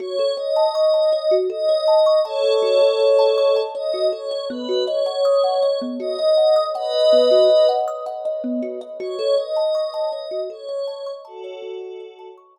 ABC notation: X:1
M:3/4
L:1/16
Q:1/4=80
K:F#dor
V:1 name="Pad 5 (bowed)"
c2 d6 d4 | [Ac]8 d2 c2 | B2 c6 d4 | [Bd]6 z6 |
c2 d6 c4 | [FA]6 z6 |]
V:2 name="Kalimba"
F A c a c' a c F A c a c' | a c F A c a c' a c F A c | B, F d f d' f d B, F d f d' | f d B, F d f d' f d B, F d |
F A c a c' a c F A c a c' | a c F A c a c' a z4 |]